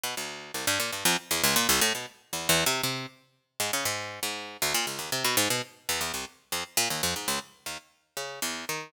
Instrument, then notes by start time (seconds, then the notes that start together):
harpsichord
0.03 B2
0.17 D2
0.54 C2
0.67 G2
0.80 A#2
0.92 G2
1.05 F2
1.31 E2
1.44 C#2
1.56 A#2
1.69 C2
1.81 A2
1.95 B2
2.33 E2
2.49 E2
2.66 C3
2.83 C3
3.60 G#2
3.73 C#3
3.85 G#2
4.23 G#2
4.62 D2
4.74 A#2
4.87 C#2
4.99 D#2
5.12 C3
5.24 B2
5.37 G#2
5.50 B2
5.89 E2
6.01 E2
6.14 C2
6.52 F2
6.77 A#2
6.90 D#2
7.03 F2
7.16 G#2
7.28 C#2
7.66 D#2
8.17 C#3
8.42 E2
8.69 D#3